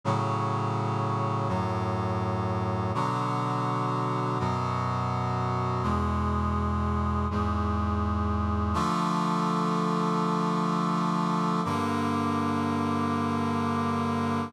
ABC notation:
X:1
M:3/4
L:1/8
Q:1/4=62
K:A
V:1 name="Brass Section"
[A,,C,F,]3 [F,,A,,F,]3 | [B,,D,F,]3 [F,,B,,F,]3 | [E,,B,,G,]3 [E,,G,,G,]3 | [K:Bb] [D,F,A,]6 |
[G,,D,B,]6 |]